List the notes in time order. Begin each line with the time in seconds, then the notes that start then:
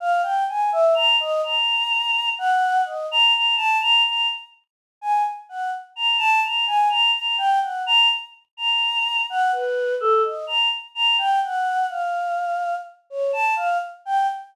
0.00 F5
0.22 G5
0.48 G#5
0.72 E5
0.94 A#5
1.20 D#5
1.43 A#5
2.38 F#5
2.85 D#5
3.11 A#5
3.33 A#5
3.56 A5
3.81 A#5
4.05 A#5
5.01 G#5
5.49 F#5
5.96 A#5
6.18 A5
6.43 A#5
6.67 G#5
6.89 A#5
7.15 A#5
7.38 G5
7.61 F#5
7.86 A#5
8.57 A#5
9.30 F#5
9.52 B4
10.00 A4
10.24 D#5
10.47 A#5
10.95 A#5
11.18 G5
11.43 F#5
11.89 F5
13.10 C#5
13.33 A5
13.56 F5
14.05 G5